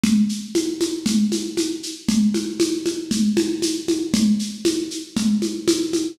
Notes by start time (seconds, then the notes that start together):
0.04 low conga, shaker
0.29 shaker
0.55 high conga, shaker
0.81 high conga, shaker
1.06 low conga, shaker
1.32 high conga, shaker
1.57 high conga, shaker
1.83 shaker
2.09 low conga, shaker
2.34 high conga, shaker
2.60 high conga, shaker
2.86 high conga, shaker
3.11 low conga, shaker
3.37 high conga, shaker
3.62 high conga, shaker
3.88 high conga, shaker
4.14 low conga, shaker
4.39 shaker
4.65 high conga, shaker
4.91 shaker
5.16 low conga, shaker
5.42 high conga, shaker
5.68 high conga, shaker
5.93 high conga, shaker